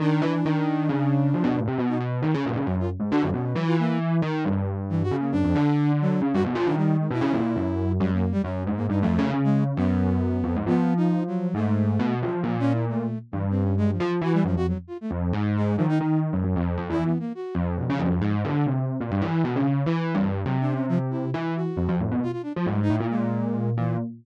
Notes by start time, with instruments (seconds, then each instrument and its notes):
0.00 electric piano 1 D#3, flute D4
0.22 electric piano 1 E3
0.45 electric piano 1 D#3
0.89 electric piano 1 C#3
1.34 electric piano 1 F3
1.44 electric piano 1 B2
1.56 electric piano 1 A2
1.68 electric piano 1 C3
1.78 electric piano 1 B2, flute B3
1.88 flute D#4
2.00 electric piano 1 B2
2.22 electric piano 1 D#3
2.34 electric piano 1 C#3
2.45 electric piano 1 A#2
2.56 electric piano 1 C#3
2.66 electric piano 1 F#2, flute C#4
2.80 flute F4
3.00 electric piano 1 G#2
3.10 electric piano 1 D3, flute F#4
3.22 electric piano 1 F#2
3.33 electric piano 1 B2, flute C#4
3.54 electric piano 1 E3, flute F#3
3.67 flute F4
3.79 flute A#3
4.22 electric piano 1 D#3
4.45 electric piano 1 G2
4.89 flute E3
5.03 flute F#4
5.11 electric piano 1 C#3
5.20 flute A#3
5.32 electric piano 1 F#2, flute D4
5.44 electric piano 1 F2
5.55 electric piano 1 D3
6.01 flute F#3
6.22 electric piano 1 C#3
6.33 electric piano 1 G2, flute F#4
6.44 electric piano 1 B2
6.55 electric piano 1 F3
6.66 electric piano 1 D#3, flute D4
6.77 flute G3
6.99 flute G#3
7.11 electric piano 1 B2, flute E4
7.21 electric piano 1 C#3
7.33 electric piano 1 A#2
7.56 electric piano 1 F#2
8.00 electric piano 1 F#2, flute G3
8.13 flute A#3
8.32 flute G3
8.44 electric piano 1 F#2, flute C#4
8.66 electric piano 1 G#2
8.76 flute A#3
8.89 electric piano 1 G2, flute D#4
9.01 electric piano 1 F2, flute A3
9.19 electric piano 1 C#3
9.34 electric piano 1 C#3
9.44 flute G#3
9.76 electric piano 1 F#2, flute B3
10.44 electric piano 1 F2
10.56 electric piano 1 G#2
10.67 electric piano 1 F3, flute B3
10.97 flute D#4
11.27 flute F#3
11.54 electric piano 1 G#2, flute A3
11.99 electric piano 1 B2
12.22 electric piano 1 F3, flute F3
12.43 electric piano 1 A#2, flute F3
12.59 flute C#4
12.72 flute E4
12.89 flute A3
13.31 electric piano 1 G2, flute E3
13.50 flute C4
13.62 flute C#4
13.77 flute G#3
13.91 flute F3
14.00 electric piano 1 F3
14.08 flute F3
14.21 electric piano 1 E3, flute F#4
14.33 flute G3
14.45 electric piano 1 F#2, flute F3
14.56 electric piano 1 F2, flute F#4
14.68 flute F#3
14.87 flute F4
15.01 flute A3
15.11 electric piano 1 F2
15.33 electric piano 1 G#2
15.56 flute G#3
15.77 electric piano 1 D#3, flute F3
15.89 flute D#4
16.00 electric piano 1 D#3, flute D#4
16.33 electric piano 1 F#2
16.44 electric piano 1 F#2
16.56 electric piano 1 F2
16.77 electric piano 1 F2
16.89 electric piano 1 E3, flute E4
17.05 flute B3
17.19 flute A#3
17.35 flute F#4
17.55 electric piano 1 F2, flute F3
17.77 electric piano 1 B2
17.90 electric piano 1 C#3
17.99 electric piano 1 F2
18.22 electric piano 1 G#2
18.44 electric piano 1 D3
18.66 electric piano 1 C3
19.01 electric piano 1 A#2
19.11 electric piano 1 G2
19.22 electric piano 1 E3
19.44 electric piano 1 B2
19.55 electric piano 1 C#3
19.86 electric piano 1 E3
20.15 electric piano 1 G2
20.45 electric piano 1 C3, flute F#3
20.61 flute D4
20.72 flute C#4
20.89 flute F3
21.10 flute E4
21.34 electric piano 1 E3
21.56 flute F#4
21.77 electric piano 1 F2
21.89 electric piano 1 F2
22.00 electric piano 1 A2
22.11 electric piano 1 B2
22.23 flute F4
22.32 flute F4
22.43 flute D4
22.56 electric piano 1 F3
22.66 electric piano 1 G#2, flute G3
22.82 flute D#4
22.90 electric piano 1 A2
22.94 flute E4
23.00 electric piano 1 A#2
23.10 flute G#3
23.77 electric piano 1 A#2, flute E3